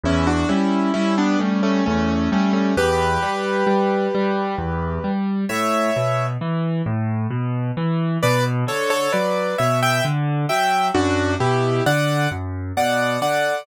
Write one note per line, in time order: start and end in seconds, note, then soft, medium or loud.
0.04 0.45 E2 loud
0.04 0.27 C#4 medium
0.04 0.27 E4 loud
0.27 0.48 D4 medium
0.27 0.48 F#4 loud
0.49 0.90 G3 medium
0.49 0.93 C#4 medium
0.49 0.93 E4 medium
0.94 1.36 G3 medium
0.94 1.16 C#4 medium
0.94 1.16 E4 loud
1.18 1.39 B3 medium
1.18 1.39 D4 loud
1.39 1.82 G3 medium
1.39 1.61 A3 medium
1.39 1.61 C#4 medium
1.63 1.84 A3 medium
1.63 1.84 C#4 loud
1.86 2.28 E2 medium
1.86 2.30 A3 medium
1.86 2.30 C#4 medium
2.32 2.73 G3 medium
2.32 2.53 A3 medium
2.32 2.53 C#4 medium
2.53 2.75 A3 medium
2.53 2.75 C#4 medium
2.77 3.18 E2 loud
2.77 5.11 G4 loud
2.77 5.11 B4 loud
3.23 3.63 G3 medium
3.67 4.08 G3 medium
4.15 4.55 G3 medium
4.58 4.99 E2 medium
5.04 5.45 G3 medium
5.49 5.91 A2 medium
5.49 6.26 C#5 medium
5.49 6.26 E5 medium
5.96 6.37 B2 medium
6.41 6.82 E3 medium
6.86 7.27 A2 medium
7.30 7.71 B2 medium
7.77 8.18 E3 medium
8.23 8.64 B2 medium
8.23 8.44 B4 loud
8.23 8.44 D5 loud
8.67 9.08 D3 medium
8.67 8.90 A4 medium
8.67 8.90 C#5 loud
8.90 9.12 A4 medium
8.90 9.12 C#5 loud
9.13 9.55 F#3 medium
9.13 9.57 B4 medium
9.13 9.57 D5 medium
9.58 10.01 B2 medium
9.58 9.80 C#5 medium
9.58 9.80 E5 medium
9.83 10.04 E5 loud
9.83 10.04 G5 loud
10.05 10.46 D3 medium
10.49 10.91 F#3 medium
10.49 10.88 E5 medium
10.49 10.88 G5 medium
10.95 11.36 F#2 loud
10.95 11.35 D4 loud
10.95 11.35 F#4 loud
11.40 11.81 B2 medium
11.40 11.83 E4 medium
11.40 11.83 G4 medium
11.86 12.27 D3 medium
11.86 12.29 D5 medium
11.86 12.29 F#5 loud
12.31 12.72 F#2 medium
12.77 13.18 B2 medium
12.77 13.20 D5 medium
12.77 13.20 F#5 medium
13.21 13.62 D3 medium
13.21 13.66 D5 medium
13.21 13.66 F#5 medium